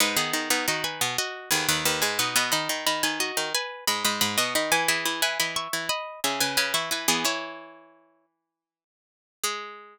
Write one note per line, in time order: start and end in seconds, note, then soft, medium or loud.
0.00 0.16 G#2 medium
0.00 0.16 G#3 loud
0.00 0.16 D#4 loud
0.00 0.16 B4 loud
0.17 0.33 D#3 medium
0.17 0.49 B3 loud
0.17 0.33 D#4 medium
0.17 0.49 G#4 loud
0.33 0.49 D#3 medium
0.33 0.49 D#4 medium
0.50 0.66 B2 medium
0.50 0.66 B3 loud
0.50 0.66 D#4 medium
0.50 0.66 B4 loud
0.68 1.01 D#3 medium
0.68 1.01 D#4 medium
0.68 0.84 F#4 medium
0.68 0.84 D#5 loud
0.84 1.15 B4 medium
0.84 1.15 G#5 loud
1.01 1.17 B2 medium
1.01 1.17 B3 loud
1.18 1.49 F#4 loud
1.18 1.49 D#5 loud
1.51 1.68 D#2 medium
1.51 1.68 D#3 loud
1.51 1.67 B3 medium
1.51 1.67 G#4 loud
1.69 1.85 D#2 medium
1.69 1.85 D#3 loud
1.69 1.85 D#4 medium
1.69 1.85 B4 loud
1.85 2.02 D#2 medium
1.85 2.02 D#3 loud
1.85 2.01 D#4 medium
1.85 2.01 B4 loud
2.02 2.18 G#2 medium
2.02 2.18 G#3 loud
2.02 2.18 B4 medium
2.02 2.18 G#5 medium
2.19 2.35 B2 medium
2.19 2.35 B3 medium
2.19 2.35 D#4 medium
2.19 2.35 B4 loud
2.36 2.52 B2 loud
2.36 2.52 B3 loud
2.36 2.51 D#5 loud
2.36 2.51 B5 loud
2.52 2.69 D#3 medium
2.52 2.69 D#4 loud
2.52 2.84 D#5 medium
2.52 2.84 B5 loud
2.69 2.85 D#3 medium
2.69 2.85 D#4 medium
2.87 3.03 D#3 medium
2.87 3.03 D#4 loud
2.87 3.03 D#5 loud
2.87 3.03 B5 loud
3.03 3.32 D#3 medium
3.03 3.32 D#4 medium
3.03 3.19 B4 medium
3.03 3.19 G#5 loud
3.20 3.50 F#4 medium
3.20 3.50 D#5 loud
3.37 3.53 D#3 medium
3.37 3.53 D#4 loud
3.54 3.84 B4 loud
3.54 3.84 G#5 loud
3.87 4.04 G#2 medium
3.87 4.04 G#3 medium
3.87 4.04 D#5 medium
3.87 4.04 B5 loud
4.04 4.21 G#2 medium
4.04 4.21 G#3 loud
4.04 4.21 D#5 medium
4.04 4.21 B5 loud
4.21 4.37 G#2 medium
4.21 4.37 G#3 loud
4.21 4.37 D#5 medium
4.21 4.37 B5 loud
4.38 4.54 B2 medium
4.38 4.54 B3 loud
4.38 4.54 F#4 medium
4.38 4.54 D#5 loud
4.55 4.71 D#3 medium
4.55 4.71 D#4 medium
4.55 4.72 D#5 medium
4.55 4.72 B5 loud
4.72 4.88 E3 loud
4.72 4.88 E4 loud
4.72 4.88 B4 loud
4.72 4.88 G#5 loud
4.88 5.04 E3 medium
4.88 5.04 E4 loud
4.88 5.21 G#4 medium
4.88 5.21 E5 loud
5.05 5.21 E3 medium
5.05 5.21 E4 loud
5.22 5.38 E3 medium
5.22 5.38 E4 medium
5.22 5.38 B4 loud
5.22 5.38 G#5 loud
5.40 5.68 E3 medium
5.40 5.68 E4 medium
5.40 5.56 D#5 medium
5.40 5.56 B5 medium
5.56 5.86 E5 medium
5.56 5.86 C#6 loud
5.73 5.89 E3 medium
5.73 5.89 E4 medium
5.89 6.20 D#5 loud
5.89 6.20 B5 loud
6.24 6.40 C#3 medium
6.24 6.40 C#4 medium
6.24 6.40 G#4 medium
6.24 6.40 E5 loud
6.40 6.57 C#3 medium
6.40 6.57 C#4 loud
6.40 6.56 B4 loud
6.40 6.56 G#5 loud
6.57 6.73 C#3 medium
6.57 6.73 C#4 loud
6.57 6.73 B4 loud
6.57 6.73 G#5 loud
6.74 6.90 E3 medium
6.74 6.90 E4 medium
6.74 6.90 E5 loud
6.74 6.90 C#6 loud
6.91 7.07 E3 medium
6.91 7.07 E4 medium
6.91 7.08 B4 medium
6.91 7.08 G#5 medium
7.08 7.24 E3 loud
7.08 7.24 B3 loud
7.08 7.24 E4 loud
7.08 7.24 G#4 loud
7.25 8.84 E3 medium
7.25 8.84 E4 medium
7.25 8.26 E4 loud
7.25 8.26 C#5 loud
9.44 9.98 G#3 loud
9.44 9.98 G#4 loud